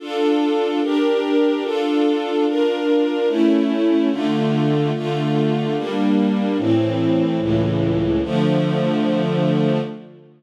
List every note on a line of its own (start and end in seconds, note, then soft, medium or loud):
0.00 0.80 D4 loud
0.00 0.80 F4 loud
0.00 0.80 A4 loud
0.82 1.63 D4 loud
0.82 1.63 G4 medium
0.82 1.63 A#4 medium
1.64 2.45 D4 loud
1.64 2.45 F4 loud
1.64 2.45 A4 medium
2.47 3.29 D4 medium
2.47 3.29 F4 medium
2.47 3.29 A#4 medium
3.28 4.09 A3 loud
3.28 4.09 C#4 medium
3.28 4.09 E4 loud
4.11 4.92 D3 loud
4.11 4.92 A3 loud
4.11 4.92 F4 medium
4.95 5.76 D3 medium
4.95 5.76 A3 medium
4.95 5.76 F4 loud
5.76 6.57 G3 loud
5.76 6.57 A#3 medium
5.76 6.57 D4 medium
6.58 7.39 A2 medium
6.58 7.39 E3 medium
6.58 7.39 C4 medium
7.40 8.21 C#2 medium
7.40 8.21 A2 medium
7.40 8.21 E3 medium
8.23 9.79 D3 medium
8.23 9.79 F3 loud
8.23 9.79 A3 loud